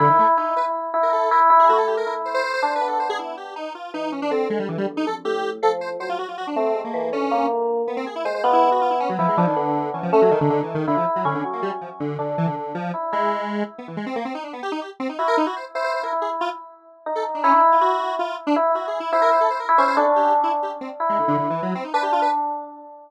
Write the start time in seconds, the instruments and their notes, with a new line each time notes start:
0.00 lead 1 (square) D3, electric piano 1 E4
0.10 lead 1 (square) D#3
0.19 lead 1 (square) A3
0.37 lead 1 (square) D#4, electric piano 1 E4
0.56 electric piano 1 E4, lead 1 (square) B4
0.94 electric piano 1 E4
1.03 lead 1 (square) A#4
1.13 lead 1 (square) A4
1.31 electric piano 1 E4, lead 1 (square) A#4
1.50 electric piano 1 E4
1.59 lead 1 (square) G#4
1.69 electric piano 1 A3, lead 1 (square) F#4
1.78 lead 1 (square) A4
1.87 lead 1 (square) G4
1.97 lead 1 (square) A#4
2.06 electric piano 1 E4
2.25 lead 1 (square) C5
2.34 lead 1 (square) C5
2.44 lead 1 (square) C5
2.54 lead 1 (square) C5
2.62 electric piano 1 D4, lead 1 (square) C5
2.75 lead 1 (square) B4
2.81 electric piano 1 B3
2.87 lead 1 (square) A4
3.00 lead 1 (square) C5
3.09 lead 1 (square) G#4
3.19 lead 1 (square) E4
3.37 lead 1 (square) G4
3.56 lead 1 (square) D#4
3.75 lead 1 (square) F4
3.94 electric piano 1 E3, lead 1 (square) D#4
4.12 lead 1 (square) C#4
4.22 lead 1 (square) D4
4.31 electric piano 1 D3, lead 1 (square) C4
4.50 lead 1 (square) G#3
4.59 lead 1 (square) G3
4.69 electric piano 1 G2, lead 1 (square) E3
4.78 lead 1 (square) G3
4.88 electric piano 1 E2
4.97 lead 1 (square) D#4
5.06 electric piano 1 F2, lead 1 (square) A4
5.25 electric piano 1 A2, lead 1 (square) G4
5.62 electric piano 1 F3, lead 1 (square) A4
5.81 lead 1 (square) C5
6.00 electric piano 1 F#3, lead 1 (square) C5
6.09 lead 1 (square) F4
6.19 lead 1 (square) F#4
6.28 lead 1 (square) F4
6.38 lead 1 (square) F#4
6.47 lead 1 (square) D4
6.56 electric piano 1 A3, lead 1 (square) C4
6.75 electric piano 1 G#3
6.84 lead 1 (square) A#3
6.94 electric piano 1 E3
7.12 electric piano 1 D3, lead 1 (square) C#4
7.31 electric piano 1 A#3
7.87 lead 1 (square) B3
7.97 lead 1 (square) C4
8.06 lead 1 (square) G#4
8.16 lead 1 (square) E4
8.25 electric piano 1 G#3, lead 1 (square) C5
8.34 lead 1 (square) C5
8.44 electric piano 1 B3, lead 1 (square) F4
8.53 lead 1 (square) E4
8.72 lead 1 (square) F#4
8.81 lead 1 (square) F4
8.90 lead 1 (square) E4
9.00 lead 1 (square) C#4
9.09 lead 1 (square) F#3
9.19 lead 1 (square) F3, electric piano 1 E4
9.28 lead 1 (square) G#3
9.37 lead 1 (square) F3, electric piano 1 D4
9.47 lead 1 (square) D#3
9.56 lead 1 (square) D3, electric piano 1 B3
9.94 lead 1 (square) E3, electric piano 1 C#4
10.03 lead 1 (square) F3
10.12 electric piano 1 A3, lead 1 (square) C#4
10.22 lead 1 (square) F#3
10.31 lead 1 (square) D#3, electric piano 1 D#4
10.41 lead 1 (square) D3
10.50 lead 1 (square) D3
10.63 lead 1 (square) E3
10.75 lead 1 (square) D#3
10.88 lead 1 (square) D3, electric piano 1 E4
10.97 lead 1 (square) F3
11.16 lead 1 (square) F#3
11.25 lead 1 (square) D3, electric piano 1 C#4
11.34 lead 1 (square) D3
11.44 electric piano 1 F#3
11.53 lead 1 (square) A#3
11.62 lead 1 (square) G3
11.81 lead 1 (square) F3
12.00 lead 1 (square) D3
12.19 lead 1 (square) D3, electric piano 1 D4
12.38 lead 1 (square) E3
12.47 lead 1 (square) D3
12.56 lead 1 (square) D3
12.75 lead 1 (square) F3
12.94 electric piano 1 E4
13.12 lead 1 (square) G#3, electric piano 1 E4
13.78 lead 1 (square) B3
13.88 lead 1 (square) E3
13.97 lead 1 (square) G#3
14.06 lead 1 (square) C4
14.16 lead 1 (square) A#3
14.25 lead 1 (square) C4
14.35 lead 1 (square) D#4
14.44 lead 1 (square) D4
14.53 lead 1 (square) B3
14.63 lead 1 (square) G4
14.72 lead 1 (square) D#4
14.81 lead 1 (square) G4
15.00 lead 1 (square) C4
15.09 lead 1 (square) D#4
15.19 electric piano 1 E4, lead 1 (square) F#4
15.28 lead 1 (square) A#4
15.37 lead 1 (square) D#4
15.46 lead 1 (square) F#4
15.56 lead 1 (square) C5
15.75 electric piano 1 E4, lead 1 (square) C5
15.84 lead 1 (square) C5
15.94 lead 1 (square) C5
16.03 electric piano 1 E4, lead 1 (square) A#4
16.12 electric piano 1 E4
16.22 lead 1 (square) G#4
16.41 lead 1 (square) F4
17.06 electric piano 1 D#4
17.15 lead 1 (square) A4
17.35 lead 1 (square) D4
17.44 lead 1 (square) C#4, electric piano 1 E4
17.53 lead 1 (square) D4
17.72 lead 1 (square) F4
17.81 electric piano 1 E4, lead 1 (square) F#4
18.19 lead 1 (square) F4
18.47 lead 1 (square) D4
18.56 electric piano 1 E4
18.75 electric piano 1 E4, lead 1 (square) F#4
18.87 lead 1 (square) G#4
19.00 lead 1 (square) E4
19.12 electric piano 1 E4, lead 1 (square) C5
19.22 lead 1 (square) A#4
19.31 lead 1 (square) C5
19.41 lead 1 (square) A4
19.50 lead 1 (square) C5
19.60 lead 1 (square) A#4
19.69 electric piano 1 E4
19.78 electric piano 1 C#4, lead 1 (square) C5
19.88 lead 1 (square) C5
19.97 electric piano 1 D4, lead 1 (square) A4
20.16 lead 1 (square) G4
20.44 lead 1 (square) E4
20.63 lead 1 (square) G4
20.81 lead 1 (square) C4
21.00 electric piano 1 E4
21.09 lead 1 (square) G#3
21.19 lead 1 (square) D3
21.28 lead 1 (square) D3
21.38 lead 1 (square) D3
21.50 lead 1 (square) E3
21.62 lead 1 (square) F#3
21.75 lead 1 (square) C4
21.84 lead 1 (square) D#4
21.94 electric piano 1 D4, lead 1 (square) B4
22.03 lead 1 (square) G4
22.12 lead 1 (square) F4
22.22 lead 1 (square) B4